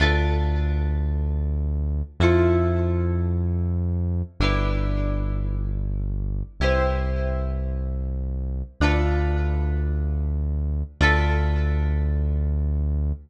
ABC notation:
X:1
M:4/4
L:1/8
Q:1/4=109
K:Ddor
V:1 name="Acoustic Guitar (steel)"
[DFAB]8 | [EFAc]8 | [DEGB]8 | [EGBc]8 |
[DFAB]8 | [DFAB]8 |]
V:2 name="Synth Bass 1" clef=bass
D,,8 | F,,8 | G,,,8 | C,,8 |
D,,8 | D,,8 |]